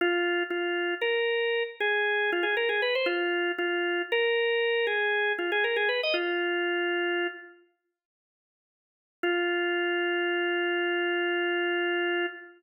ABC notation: X:1
M:12/8
L:1/16
Q:3/8=78
K:Fm
V:1 name="Drawbar Organ"
F4 F4 B6 A4 F A B A =B c | F4 F4 B6 A4 F A B A =B e | F10 z14 | F24 |]